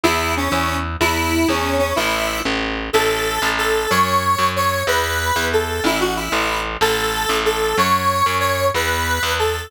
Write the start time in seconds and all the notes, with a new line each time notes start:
0.03 E2 E4
0.37 C#4
0.50 E2 C#4
1.00 E2 E4
1.48 E2 C#4
1.79 C#4
1.96 A1 E4
2.45 A1
2.93 A1 A4
3.42 A1
3.58 A4
3.90 F#2 C#5
4.39 F#2
4.56 C#5
4.87 E2 B4
5.36 E2
5.53 A4
5.84 A1 E4
6.00 F#4
6.16 E4
6.32 A1
6.81 A1 A4
7.29 A1
7.45 A4
7.78 F#2 C#5
8.26 F#2
8.40 C#5
8.74 E2 B4
9.23 E2
9.39 A4